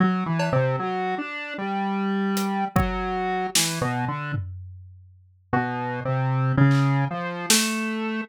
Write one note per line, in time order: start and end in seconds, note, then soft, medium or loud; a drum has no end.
0.00 0.24 F#3 medium
0.26 0.50 E3 medium
0.39 cowbell loud
0.52 0.76 C3 loud
0.79 1.15 F#3 medium
1.18 1.54 D4 medium
1.58 2.65 G3 medium
2.37 closed hi-hat medium
2.76 3.47 F#3 medium
2.76 kick loud
3.55 3.79 E3 medium
3.55 snare loud
3.81 4.05 B2 medium
4.08 4.32 D3 medium
4.34 floor tom medium
5.53 6.00 B2 medium
6.05 6.52 C3 medium
6.57 7.05 C#3 loud
6.71 clap medium
7.11 7.46 F3 medium
7.50 8.21 A3 loud
7.50 snare loud